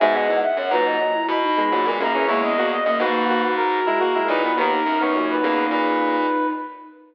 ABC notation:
X:1
M:4/4
L:1/16
Q:1/4=105
K:B
V:1 name="Brass Section"
g f2 f f a4 b5 a2 | c d2 d d B4 A5 B2 | A3 c2 B3 B6 z2 |]
V:2 name="Flute"
e d2 e c B d2 E2 D2 F A G2 | A, B, B,2 (3A,2 A,2 A,2 F6 E2 | D14 z2 |]
V:3 name="Lead 1 (square)"
[B,,G,]2 [G,,E,] z2 [A,,F,]2 [A,,F,] z3 [B,,G,] [A,,F,] [B,,G,] [C,A,] [E,C] | [G,E]2 [A,F] z2 [A,F]2 [A,F] z3 [G,E] [A,F] [G,E] [F,D] [D,B,] | [D,B,] z2 [D,B,] [A,,F,]2 [C,A,]6 z4 |]
V:4 name="Lead 1 (square)" clef=bass
G,, E,, E,, z F,, G,,2 z2 B,,3 G,, A,, F,,2 | E,,4 F,, G,,7 z2 A,,2 | D,,2 F,,4 E,,2 A,,4 z4 |]